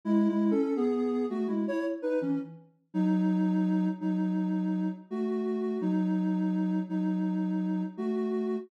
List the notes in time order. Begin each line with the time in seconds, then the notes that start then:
0.05 G#3 E4
0.28 G#3 E4
0.51 C#4 A4
0.76 B3 G#4
1.30 A3 F#4
1.47 G#3 E4
1.67 E4 C#5
2.02 D#4 B4
2.21 E3 C#4
2.94 F#3 D#4
4.01 F#3 D#4
5.10 A3 F#4
5.81 F#3 D#4
6.89 F#3 D#4
7.97 A3 F#4